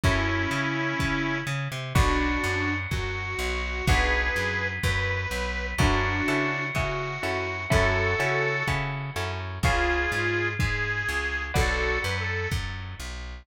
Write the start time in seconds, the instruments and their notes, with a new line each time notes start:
0.04 electric bass (finger) F#2, harmonica C#4 E4, acoustic guitar (steel) C#4 E4 F#4 A4, kick
0.51 electric bass (finger) C#3
0.99 electric bass (finger) C#3, kick
1.47 electric bass (finger) C#3
1.72 electric bass (finger) C3
1.95 electric bass (finger) B1, acoustic guitar (steel) B3 D4 F#4 A4, harmonica D4 F#4, kick
2.44 electric bass (finger) F#2
2.91 electric bass (finger) F#2, harmonica F#4, kick
3.39 electric bass (finger) B1
3.87 electric bass (finger) B1, acoustic guitar (steel) B3 D4 F#4 A4, harmonica G#4 B4, kick
4.36 electric bass (finger) F#2
4.83 electric bass (finger) F#2, harmonica B4, kick
5.31 electric bass (finger) B1
5.78 electric bass (finger) F#2, acoustic guitar (steel) C#4 E4 F#4 A4, harmonica D4 F#4, kick
6.28 electric bass (finger) C#3, acoustic guitar (steel) C#4 E4 F#4 A4
6.75 electric bass (finger) C#3, acoustic guitar (steel) C#4 E4 F#4 A4, harmonica F#4, kick
7.23 electric bass (finger) F#2, acoustic guitar (steel) C#4 E4 F#4 A4
7.70 electric bass (finger) F#2, acoustic guitar (steel) C#4 E4 F#4 A4, harmonica F#4 A4, kick
8.20 electric bass (finger) C#3, acoustic guitar (steel) C#4 E4 F#4 A4
8.68 electric bass (finger) C#3, acoustic guitar (steel) C#4 E4 F#4 A4, kick
9.16 electric bass (finger) F#2, acoustic guitar (steel) C#4 E4 F#4 A4
9.63 electric bass (finger) C#2, harmonica F4 G#4, acoustic guitar (steel) B4 C#5 F5 G#5, kick
10.12 electric bass (finger) G#2
10.59 electric bass (finger) G#2, harmonica G#4, kick
11.09 electric bass (finger) C#2
11.54 electric bass (finger) B1, harmonica F#4 A4, acoustic guitar (steel) B4 D5 F#5 A5, kick
12.04 electric bass (finger) F#2, harmonica B4
12.20 harmonica A4
12.51 electric bass (finger) F#2, kick
13.00 electric bass (finger) B1